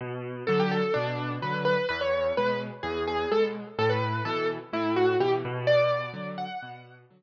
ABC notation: X:1
M:4/4
L:1/16
Q:1/4=127
K:Bm
V:1 name="Acoustic Grand Piano"
z4 A G A2 D4 B2 B2 | B c3 B2 z2 ^G2 G2 A z3 | A B3 A2 z2 E2 F2 G z3 | d6 f6 z4 |]
V:2 name="Acoustic Grand Piano" clef=bass
B,,4 [D,F,]4 B,,4 [D,F,]4 | E,,4 [B,,^G,]4 E,,4 [B,,G,]4 | A,,4 [B,,E,]4 A,,4 [B,,E,]2 B,,2- | B,,4 [D,F,]4 B,,4 [D,F,]4 |]